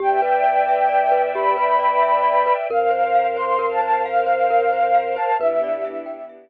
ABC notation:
X:1
M:6/8
L:1/16
Q:3/8=89
K:Ephr
V:1 name="Flute"
g2 g10 | b2 b10 | f6 c'3 a a2 | f10 a2 |
e10 z2 |]
V:2 name="Glockenspiel"
G2 B2 d2 e2 d2 B2 | G2 B2 d2 e2 d2 B2 | _B2 c2 f2 c2 B2 c2 | f2 c2 _B2 c2 f2 c2 |
B2 d2 e2 g2 e2 z2 |]
V:3 name="Synth Bass 2" clef=bass
E,,12- | E,,12 | F,,12- | F,,12 |
E,,12 |]
V:4 name="String Ensemble 1"
[Bdeg]12- | [Bdeg]12 | [_Bcf]12- | [_Bcf]12 |
[B,DEG]12 |]